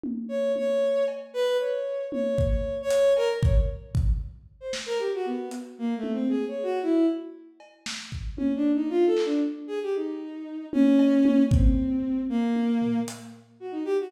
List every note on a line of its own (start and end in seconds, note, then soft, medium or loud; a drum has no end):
0.03 high tom medium
0.29 0.52 C#5 medium
0.56 1.04 C#5 medium
0.56 high tom medium
1.08 cowbell medium
1.34 1.57 B4 loud
1.59 2.06 C#5 medium
2.12 2.44 C#5 medium
2.12 high tom medium
2.38 kick loud
2.47 2.78 C#5 medium
2.82 3.14 C#5 loud
2.90 closed hi-hat loud
3.17 3.29 A#4 loud
3.17 cowbell medium
3.43 3.55 C#5 medium
3.43 kick loud
3.95 kick loud
4.60 4.72 C5 medium
4.73 snare medium
4.86 4.98 A#4 loud
4.99 5.11 G4 medium
5.14 5.26 F#4 medium
5.26 5.49 B3 medium
5.51 closed hi-hat medium
5.78 5.94 A#3 medium
5.97 6.12 A3 medium
6.03 high tom medium
6.12 6.28 C4 medium
6.29 6.45 G#4 medium
6.48 6.64 C#5 medium
6.63 6.79 F#4 medium
6.83 7.06 E4 medium
7.60 cowbell medium
7.86 snare medium
8.12 kick medium
8.37 8.52 C#4 medium
8.37 high tom medium
8.56 8.72 D4 medium
8.75 8.90 D#4 medium
8.90 9.05 F4 medium
9.06 9.22 A4 medium
9.17 clap medium
9.25 9.41 D4 medium
9.67 9.79 G#4 medium
9.83 9.94 G4 medium
9.96 10.66 D#4 medium
10.73 11.43 C#4 loud
10.73 high tom loud
10.99 cowbell medium
11.25 high tom loud
11.51 12.22 C4 medium
11.51 kick loud
12.29 13.00 A#3 medium
12.56 high tom medium
12.82 floor tom medium
13.08 closed hi-hat loud
13.60 13.72 F#4 medium
13.72 13.83 D#4 medium
13.85 13.97 G4 medium
14.01 14.12 F#4 loud